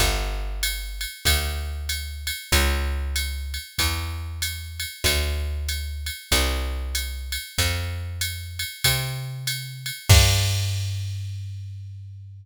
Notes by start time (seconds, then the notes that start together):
0.00 G1, kick, ride
0.63 hi-hat pedal, ride
1.01 ride
1.25 D2, kick, ride
1.89 hi-hat pedal, ride
2.27 ride
2.52 C#2, kick, ride
3.16 hi-hat pedal, ride
3.54 ride
3.78 E2, kick, ride
4.42 hi-hat pedal, ride
4.80 ride
5.04 D2, kick, ride
5.69 hi-hat pedal, ride
6.06 ride
6.31 C2, kick, ride
6.95 hi-hat pedal, ride
7.32 ride
7.58 F2, kick, ride
8.21 hi-hat pedal, ride
8.59 ride
8.84 C3, kick, ride
9.47 hi-hat pedal, ride
9.86 ride
10.09 G2, kick, crash